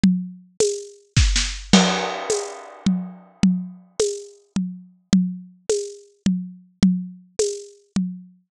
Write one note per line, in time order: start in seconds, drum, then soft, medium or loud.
0.04 low conga medium
0.60 tambourine medium
0.60 high conga medium
1.17 kick medium
1.17 snare medium
1.36 snare medium
1.73 crash loud
1.73 low conga loud
2.30 tambourine medium
2.30 high conga medium
2.86 low conga medium
3.43 low conga medium
4.00 tambourine medium
4.00 high conga medium
4.56 low conga medium
5.13 low conga medium
5.69 tambourine medium
5.69 high conga medium
6.26 low conga medium
6.83 low conga medium
7.39 tambourine medium
7.39 high conga medium
7.96 low conga medium